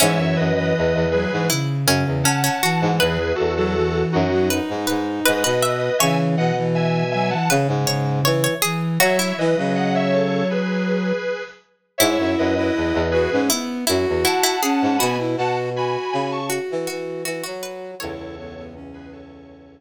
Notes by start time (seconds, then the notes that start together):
0.00 G#2 E3 C#4 C#5 E5
0.18 F#2
0.36 F#2 B4 D#5
0.55 E3 B4 D#5
0.77 E2
0.94 E2
1.11 F#3 G#4 B4
1.31 G#2 E3
1.50 C#3 E4
1.86 F#2 C#3 C#4
2.06 E2
2.23 C#4 F#5 A5
2.44 C#4
2.63 E3 F#4
2.81 G#2
2.99 E2 E3 G#4 B4
3.35 E2 F#4 A4
3.57 F#3 F#4 A4
3.75 E3
4.12 F#2 D#4 F#4
4.31 F#3
4.50 D#4 B4
4.68 G#2
4.87 G#2 B4
5.25 G#2 B4 D#5
5.44 B2 B4
5.62 E5
5.99 C#3 E3 C#5 E5 G#5
6.37 B2 D#5 F#5
6.57 E3
6.75 E5 G#5
7.11 F#3 E5 G#5
7.30 E3 F#5 A5
7.49 C#3 B4
7.67 G#2
7.87 C#3 C#5
8.24 E3 C#5
8.44 C#5
8.62 E3 G#4
9.00 F#3 F#4 C#5 E5
9.19 E4
9.37 E3 B4 D#5
9.57 C#3 F#3
9.75 D#5 F#5
9.95 C#5 E5
10.13 A4 C#5
10.50 G#4 B4
11.98 G#2 E4 C#5 E5
12.18 F#2
12.38 F#2 B4 D#5
12.55 E4 B4 D#5
12.75 E2
12.93 E2
13.11 F#4 G#4 B4
13.32 G#2 C#4
13.50 B3 E4
13.87 F#2 E4 F#4
14.08 E2
14.24 E4 F#5 A5
14.43 E4
14.62 C#4 G#4
14.82 G#2
14.98 B2 B3 F#4 G#5 B5
15.19 E4
15.36 B2 F#4 F#5 A5
15.75 F#4 G#5 B5
16.12 C#3 G#5 B5
16.31 A5 C#6
16.50 F#4
16.70 E3
16.87 E3 F#4
17.25 E3 F#4
17.43 F#3 F#4
17.63 B4
17.99 C#2 E2 E4 A4 C#5
18.38 B3
18.57 B3
18.75 C#4
18.94 G#4 B4
19.12 A4 C#5